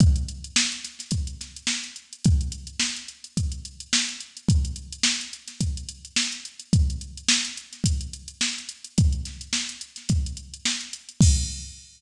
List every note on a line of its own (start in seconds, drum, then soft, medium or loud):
0.00 kick loud
0.00 closed hi-hat medium
0.16 closed hi-hat medium
0.29 closed hi-hat medium
0.44 closed hi-hat medium
0.56 snare loud
0.72 closed hi-hat medium
0.84 snare soft
0.84 closed hi-hat medium
0.99 snare soft
0.99 closed hi-hat medium
1.11 kick medium
1.11 closed hi-hat medium
1.27 closed hi-hat medium
1.41 snare soft
1.41 closed hi-hat medium
1.56 closed hi-hat medium
1.67 snare loud
1.84 closed hi-hat medium
1.96 closed hi-hat medium
2.13 closed hi-hat medium
2.24 kick loud
2.24 closed hi-hat loud
2.41 closed hi-hat medium
2.52 closed hi-hat medium
2.67 closed hi-hat medium
2.80 snare loud
2.96 closed hi-hat medium
3.08 closed hi-hat medium
3.24 closed hi-hat medium
3.37 kick medium
3.37 closed hi-hat medium
3.52 closed hi-hat medium
3.65 closed hi-hat medium
3.80 closed hi-hat medium
3.93 snare loud
4.09 closed hi-hat medium
4.20 closed hi-hat medium
4.37 closed hi-hat medium
4.48 kick medium
4.48 closed hi-hat medium
4.65 closed hi-hat medium
4.76 closed hi-hat medium
4.92 closed hi-hat medium
5.03 snare loud
5.21 closed hi-hat medium
5.33 closed hi-hat medium
5.48 snare soft
5.48 closed hi-hat medium
5.61 kick medium
5.61 closed hi-hat medium
5.77 closed hi-hat medium
5.89 closed hi-hat medium
6.05 closed hi-hat medium
6.16 snare loud
6.32 closed hi-hat medium
6.45 closed hi-hat medium
6.59 closed hi-hat medium
6.73 kick loud
6.73 closed hi-hat medium
6.90 closed hi-hat medium
7.01 closed hi-hat medium
7.17 closed hi-hat medium
7.29 snare loud
7.45 closed hi-hat medium
7.57 closed hi-hat medium
7.73 snare soft
7.73 closed hi-hat medium
7.84 kick medium
7.84 closed hi-hat loud
8.01 closed hi-hat medium
8.13 closed hi-hat medium
8.28 closed hi-hat medium
8.41 snare loud
8.58 closed hi-hat medium
8.69 closed hi-hat medium
8.84 closed hi-hat medium
8.98 kick loud
8.98 closed hi-hat loud
9.13 closed hi-hat medium
9.25 snare soft
9.25 closed hi-hat medium
9.41 closed hi-hat medium
9.53 snare medium
9.69 closed hi-hat medium
9.81 closed hi-hat medium
9.96 snare soft
9.96 closed hi-hat medium
10.09 kick medium
10.09 closed hi-hat medium
10.26 closed hi-hat medium
10.37 closed hi-hat medium
10.54 closed hi-hat medium
10.65 snare loud
10.81 closed hi-hat medium
10.93 closed hi-hat medium
11.09 closed hi-hat medium
11.21 kick loud
11.21 crash loud